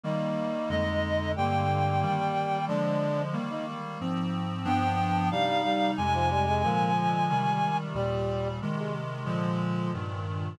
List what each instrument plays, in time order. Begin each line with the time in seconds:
0.04 clarinet D#3 G3 A#3, brass section D#4
0.69 clarinet F2 D3 G#3 D#5
1.36 clarinet G2 D3 A#3 G5, brass section G3
2.02 clarinet D#3 G3 A#3
2.68 clarinet D3 F3 G#3, brass section D4
3.33 clarinet D#3 G3 A#3
3.50 brass section D#4
4.01 clarinet G#2 F3 C4
4.64 clarinet G2 F3 B3 D4 G5
5.31 clarinet C3 G3 D#4 F5, brass section G3
5.64 brass section G3
5.97 clarinet F2 C3 G#3 G#5
6.14 brass section F3
6.30 brass section G3
6.47 brass section G#3
6.63 clarinet A#2 D3 F3 G#3, brass section A#3
7.30 clarinet C3 D#3 G3
7.95 clarinet D#2 A#2 G3, brass section G3
8.62 clarinet C3 D#3 G#3
8.78 brass section G#3
9.26 clarinet A#2 D3 F3 G#3
9.94 clarinet G2 A#2 D#3